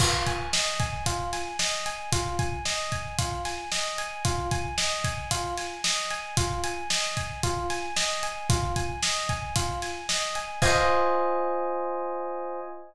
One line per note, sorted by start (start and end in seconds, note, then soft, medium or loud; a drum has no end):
0.00 0.24 F4 medium
0.00 kick loud
0.00 crash loud
0.27 0.50 G#5 medium
0.27 kick medium
0.27 closed hi-hat medium
0.53 0.77 D#5 medium
0.53 snare loud
0.80 1.04 G#5 medium
0.80 kick loud
0.80 closed hi-hat medium
1.06 1.30 F4 medium
1.06 kick medium
1.06 closed hi-hat loud
1.33 1.57 G#5 medium
1.33 snare medium
1.33 closed hi-hat medium
1.59 1.83 D#5 medium
1.59 snare loud
1.86 2.10 G#5 medium
1.86 closed hi-hat medium
2.12 2.36 F4 medium
2.12 kick loud
2.12 closed hi-hat loud
2.39 2.63 G#5 medium
2.39 kick loud
2.39 closed hi-hat medium
2.65 2.89 D#5 medium
2.65 snare loud
2.92 3.16 G#5 medium
2.92 kick medium
2.92 closed hi-hat medium
3.19 3.42 F4 medium
3.19 kick loud
3.19 closed hi-hat loud
3.45 3.69 G#5 medium
3.45 snare medium
3.45 closed hi-hat medium
3.72 3.96 D#5 medium
3.72 snare loud
3.98 4.22 G#5 medium
3.98 closed hi-hat medium
4.25 4.49 F4 medium
4.25 kick loud
4.25 closed hi-hat loud
4.51 4.75 G#5 medium
4.51 kick medium
4.51 closed hi-hat medium
4.78 5.02 D#5 medium
4.78 snare loud
5.04 5.28 G#5 medium
5.04 kick medium
5.04 closed hi-hat medium
5.31 5.55 F4 medium
5.31 kick medium
5.31 closed hi-hat loud
5.58 5.81 G#5 medium
5.58 snare medium
5.58 closed hi-hat medium
5.84 6.08 D#5 medium
5.84 snare loud
6.11 6.35 G#5 medium
6.11 snare soft
6.11 closed hi-hat medium
6.37 6.61 F4 medium
6.37 kick loud
6.37 closed hi-hat loud
6.64 6.88 G#5 medium
6.64 closed hi-hat medium
6.90 7.14 D#5 medium
6.90 snare loud
7.17 7.41 G#5 medium
7.17 kick medium
7.17 closed hi-hat medium
7.43 7.67 F4 medium
7.43 kick loud
7.43 closed hi-hat loud
7.70 7.94 G#5 medium
7.70 snare medium
7.70 closed hi-hat medium
7.96 8.20 D#5 medium
7.96 snare loud
8.23 8.47 G#5 medium
8.23 closed hi-hat medium
8.50 8.73 F4 medium
8.50 kick loud
8.50 closed hi-hat loud
8.76 9.00 G#5 medium
8.76 kick medium
8.76 closed hi-hat medium
9.03 9.27 D#5 medium
9.03 snare loud
9.29 9.53 G#5 medium
9.29 kick medium
9.29 closed hi-hat medium
9.56 9.80 F4 medium
9.56 kick loud
9.56 closed hi-hat loud
9.82 10.06 G#5 medium
9.82 snare medium
9.82 closed hi-hat medium
10.09 10.33 D#5 medium
10.09 snare loud
10.35 10.59 G#5 medium
10.35 closed hi-hat medium
10.62 12.60 F4 loud
10.62 12.60 C5 loud
10.62 12.60 D#5 loud
10.62 12.60 G#5 loud
10.62 kick loud
10.62 crash loud